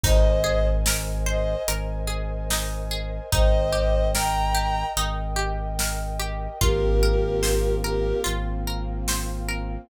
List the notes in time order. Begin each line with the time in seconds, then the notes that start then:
0.04 G#1 D#4 A#4 C5 D#5 G#5, kick, crash
0.44 G#4
0.86 A#4, snare
1.26 C5 D#5
1.68 G#1 A#4, closed hi-hat
2.07 G#4
2.50 D#4, snare
2.91 G#4
3.32 G#1 D#4 A#4 C5 D#5 G5, kick, closed hi-hat
3.73 G4
4.14 A#4 G5 A#5, snare
4.55 G4
4.97 G#1 D#4, closed hi-hat
5.36 G4
5.79 A#4, snare
6.20 G4
6.61 G#1 A#3 C4 F4 G4 A#4, kick, closed hi-hat
7.03 A#4
7.43 C5, snare
7.84 G4 A#4
8.24 G#1 F4, closed hi-hat
8.67 A#4
9.08 C5, snare
9.48 A#4